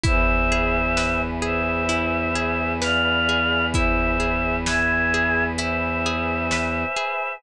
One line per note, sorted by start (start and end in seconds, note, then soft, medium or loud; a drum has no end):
0.03 6.85 E2 medium
0.03 0.45 E4 medium
0.03 7.36 B4 loud
0.03 1.21 C5 medium
0.03 1.21 E5 medium
0.03 7.36 E5 medium
0.03 7.36 G#5 loud
0.03 kick loud
0.03 closed hi-hat loud
0.52 0.93 G#4 medium
0.97 1.38 B4 medium
0.97 snare loud
1.42 1.84 G#4 medium
1.42 2.73 C5 medium
1.42 2.73 E5 medium
1.89 2.30 E4 medium
1.89 closed hi-hat loud
2.35 2.77 G#4 medium
2.82 3.23 B4 medium
2.82 3.66 D5 medium
2.82 3.66 F5 medium
2.82 snare loud
3.29 3.70 G#4 medium
3.73 4.16 E4 medium
3.73 4.56 C5 medium
3.73 4.56 E5 medium
3.73 kick loud
3.73 closed hi-hat loud
4.20 4.61 G#4 medium
4.66 5.08 B4 medium
4.66 5.44 E5 medium
4.66 5.44 G#5 medium
4.66 snare loud
5.14 5.55 G#4 medium
5.58 6.00 E4 medium
5.58 7.34 C5 medium
5.58 7.34 E5 medium
5.58 closed hi-hat loud
6.06 6.48 G#4 medium
6.51 6.94 B4 medium
6.51 snare loud
6.96 7.38 G#4 medium